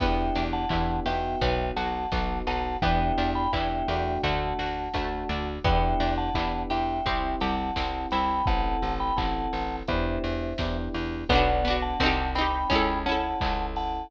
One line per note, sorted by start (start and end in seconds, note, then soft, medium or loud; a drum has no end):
0.00 0.30 E2 medium
0.00 1.34 B3 medium
0.00 0.64 B3 medium
0.00 0.64 D4 medium
0.00 0.64 E4 medium
0.00 0.64 G4 medium
0.00 0.44 E5 medium
0.00 0.44 G5 medium
0.00 kick loud
0.00 crash loud
0.35 0.66 E2 medium
0.35 1.36 D4 medium
0.35 open hi-hat medium
0.53 1.00 F#5 medium
0.53 1.00 A5 medium
0.69 1.00 E2 medium
0.69 1.05 B3 medium
0.69 1.05 D4 medium
0.69 1.38 E4 soft
0.69 1.05 E4 medium
0.69 1.05 G4 medium
0.69 kick medium
0.69 clap loud
1.06 1.36 E2 medium
1.06 2.04 B3 medium
1.06 2.04 D#4 medium
1.06 2.04 F#4 medium
1.06 1.39 G4 medium
1.06 1.69 E5 medium
1.06 1.69 G5 medium
1.06 open hi-hat medium
1.41 1.71 B1 medium
1.41 2.11 B3 medium
1.41 kick medium
1.41 closed hi-hat medium
1.76 2.06 B1 medium
1.76 2.77 F#4 medium
1.76 2.39 F#5 medium
1.76 2.39 A5 medium
1.76 open hi-hat medium
2.12 2.42 B1 medium
2.12 2.75 B3 medium
2.12 2.79 B3 soft
2.12 2.75 D#4 medium
2.12 2.75 F#4 medium
2.12 kick medium
2.12 snare loud
2.47 2.77 B1 medium
2.47 2.80 D#4 medium
2.47 2.78 F#5 medium
2.47 2.78 A5 medium
2.47 open hi-hat medium
2.82 3.12 E2 medium
2.82 3.46 B3 medium
2.82 4.17 B3 medium
2.82 3.46 D4 medium
2.82 3.46 E4 medium
2.82 3.46 G4 medium
2.82 3.30 E5 medium
2.82 3.30 G5 medium
2.82 kick medium
2.82 closed hi-hat medium
3.18 3.48 E2 medium
3.18 4.19 D4 medium
3.18 open hi-hat medium
3.35 3.52 G5 medium
3.35 3.52 B5 medium
3.53 3.83 E2 medium
3.53 3.87 B3 medium
3.53 3.87 D4 medium
3.53 3.87 E4 medium
3.53 4.20 E4 medium
3.53 3.87 G4 medium
3.53 4.21 E5 medium
3.53 4.21 G5 medium
3.53 kick medium
3.53 clap loud
3.88 4.18 E2 medium
3.88 4.87 A3 medium
3.88 4.87 D4 medium
3.88 4.87 F#4 medium
3.88 4.22 G4 soft
3.88 open hi-hat medium
4.23 4.53 D2 medium
4.23 4.94 A3 medium
4.23 5.48 F#5 medium
4.23 5.48 A5 medium
4.23 kick medium
4.23 closed hi-hat medium
4.59 4.89 D2 medium
4.59 5.60 F#4 medium
4.59 open hi-hat medium
4.94 5.24 D2 medium
4.94 5.58 A3 medium
4.94 5.61 A3 medium
4.94 5.58 D4 medium
4.94 5.58 F#4 medium
4.94 kick medium
4.94 snare medium
5.29 5.59 D2 medium
5.29 5.63 D4 medium
5.29 open hi-hat medium
5.64 5.94 E2 medium
5.64 6.99 B3 medium
5.64 6.29 B3 medium
5.64 6.29 D4 medium
5.64 6.29 E4 medium
5.64 6.29 G4 medium
5.64 6.14 E5 medium
5.64 6.14 G5 medium
5.64 kick loud
5.64 closed hi-hat loud
6.00 6.30 E2 medium
6.00 7.01 D4 medium
6.00 open hi-hat medium
6.18 6.63 F#5 medium
6.18 6.63 A5 medium
6.34 6.65 E2 medium
6.34 6.99 B3 medium
6.34 6.99 D4 medium
6.34 6.99 E4 medium
6.34 7.02 E4 medium
6.34 6.99 G4 medium
6.34 kick medium
6.34 clap loud
6.70 7.01 E2 medium
6.70 7.03 G4 medium
6.70 7.36 E5 medium
6.70 7.36 G5 medium
6.70 open hi-hat medium
7.06 7.36 C2 medium
7.06 7.70 C4 medium
7.06 7.75 C4 medium
7.06 7.70 E4 medium
7.06 7.70 G4 medium
7.06 kick medium
7.06 closed hi-hat medium
7.40 7.71 C2 medium
7.40 8.42 G4 medium
7.40 8.08 F#5 medium
7.40 8.08 A5 medium
7.40 open hi-hat medium
7.76 8.06 C2 medium
7.76 8.43 C4 medium
7.76 8.41 C4 medium
7.76 8.41 E4 medium
7.76 8.41 G4 medium
7.76 kick medium
7.76 snare loud
8.11 8.42 C2 medium
8.11 8.46 E4 medium
8.11 8.46 G5 medium
8.11 8.46 B5 medium
8.11 open hi-hat medium
8.46 8.77 A1 medium
8.46 9.10 C4 medium
8.46 9.10 E4 medium
8.46 9.10 A4 medium
8.46 8.94 F#5 medium
8.46 8.94 A5 medium
8.46 kick loud
8.46 closed hi-hat medium
8.82 9.12 A1 medium
8.82 open hi-hat medium
9.00 9.17 G5 medium
9.00 9.17 B5 medium
9.16 9.48 A1 medium
9.16 9.80 C4 medium
9.16 9.80 E4 medium
9.16 9.80 A4 medium
9.16 9.76 F#5 medium
9.16 9.76 A5 medium
9.16 kick medium
9.16 clap loud
9.53 9.83 A1 medium
9.53 open hi-hat medium
9.87 10.19 E2 medium
9.87 10.52 B3 medium
9.87 10.52 D4 medium
9.87 10.52 E4 medium
9.87 10.52 G4 medium
9.87 10.78 C5 medium
9.87 10.78 E5 medium
9.87 kick medium
9.87 closed hi-hat medium
10.24 10.54 E2 medium
10.24 open hi-hat medium
10.58 10.89 E2 medium
10.58 11.23 B3 medium
10.58 11.23 D4 medium
10.58 11.23 E4 medium
10.58 11.23 G4 medium
10.58 kick medium
10.58 snare loud
10.94 11.24 E2 medium
10.94 open hi-hat medium
11.29 11.94 B1 medium
11.29 11.62 B3 medium
11.29 11.97 B3 medium
11.29 11.62 D4 medium
11.29 11.76 D5 medium
11.29 11.76 F#5 medium
11.29 kick medium
11.29 closed hi-hat loud
11.35 11.62 F#4 medium
11.65 11.97 B3 medium
11.65 11.99 D4 medium
11.65 11.97 D4 medium
11.65 open hi-hat medium
11.70 11.97 F#4 medium
11.82 12.31 F#5 medium
11.82 12.31 A5 medium
12.00 12.65 C2 loud
12.00 12.67 C4 medium
12.00 12.33 C4 medium
12.00 12.33 D#4 medium
12.00 kick medium
12.00 snare loud
12.06 12.33 G4 medium
12.35 12.68 C4 medium
12.35 12.68 D#4 medium
12.35 12.99 G5 medium
12.35 12.99 B5 medium
12.35 open hi-hat medium
12.41 12.68 G4 medium
12.70 13.34 C#2 medium
12.70 13.02 C#4 medium
12.70 14.04 C#4 medium
12.70 13.02 E4 medium
12.70 kick medium
12.70 closed hi-hat medium
12.75 13.02 A4 medium
13.06 14.03 C#4 medium
13.06 13.77 E4 medium
13.06 14.03 E4 medium
13.06 13.66 F#5 medium
13.06 13.66 A5 medium
13.06 open hi-hat medium
13.12 14.03 A4 medium
13.41 14.05 C#2 medium
13.41 14.09 A4 medium
13.41 kick medium
13.41 clap loud
13.76 14.11 E4 medium
13.76 14.07 F#5 medium
13.76 14.07 A5 medium
13.76 open hi-hat medium